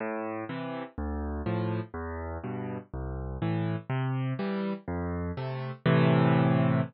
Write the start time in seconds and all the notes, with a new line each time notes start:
0.00 A2
0.49 C3 E3
0.98 D2
1.46 A2 F3
1.94 E2
2.44 G2 B2
2.94 C2
3.42 A2 E3
3.90 C3
4.39 E3 G3
4.88 F2
5.37 C3 A3
5.86 A2 C3 E3